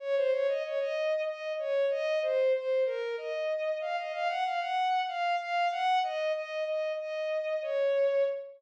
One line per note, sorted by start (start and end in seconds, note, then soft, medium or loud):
0.00 0.15 C#5 loud
0.16 0.31 C5 loud
0.32 0.47 C#5 loud
0.48 0.63 D#5 medium
0.63 0.79 C#5 medium
0.79 1.21 D#5 medium
1.27 1.53 D#5 medium
1.59 1.86 C#5 medium
1.90 2.19 D#5 loud
2.22 2.53 C5 medium
2.54 2.84 C5 medium
2.86 3.16 A#4 medium
3.17 3.77 D#5 medium
3.81 3.96 F5 medium
3.97 4.12 D#5 medium
4.13 4.28 F5 loud
4.29 4.44 F#5 medium
4.44 4.60 F5 medium
4.60 5.02 F#5 medium
5.08 5.36 F5 medium
5.40 5.68 F5 medium
5.71 5.99 F#5 loud
6.03 6.32 D#5 medium
6.35 6.64 D#5 medium
6.67 6.92 D#5 medium
6.98 7.60 D#5 medium
7.62 8.24 C#5 medium